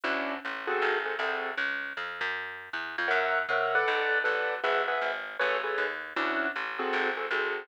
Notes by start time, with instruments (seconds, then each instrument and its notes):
0.04 electric bass (finger) D2, acoustic grand piano C#4 D4 E4 F#4
0.45 electric bass (finger) A1
0.67 acoustic grand piano C4 F#4 G#4 A4
0.82 electric bass (finger) G#1
1.05 acoustic grand piano C4 F#4 G#4 A4
1.19 electric bass (finger) C2, acoustic grand piano C4 F#4 G#4 A4
1.57 electric bass (finger) C#2
1.97 electric bass (finger) F2
2.21 electric bass (finger) F#2
2.73 electric bass (finger) E2
2.98 electric bass (finger) F2
3.08 electric bass (finger) F#2, acoustic grand piano A#4 C#5 E5 F#5
3.49 electric bass (finger) C3, acoustic grand piano A#4 C#5 E5 F#5
3.75 acoustic grand piano A4 B4 D5 F#5
3.88 electric bass (finger) B1
4.24 electric bass (finger) A1, acoustic grand piano A4 B4 D5 F#5
4.64 electric bass (finger) G#1, acoustic grand piano G#4 B4 E5 F#5
4.88 acoustic grand piano G#4 B4 E5 F#5
5.01 electric bass (finger) G#1
5.39 electric bass (finger) A1, acoustic grand piano G#4 A4 B4 C#5
5.64 acoustic grand piano G#4 A4 B4 C#5
5.78 electric bass (finger) D#2
6.16 electric bass (finger) D2, acoustic grand piano C#4 D4 E4 F#4
6.56 electric bass (finger) A1
6.79 acoustic grand piano C4 F#4 G#4 A4
6.93 electric bass (finger) G#1
7.17 acoustic grand piano C4 F#4 G#4 A4
7.31 electric bass (finger) C2, acoustic grand piano C4 F#4 G#4 A4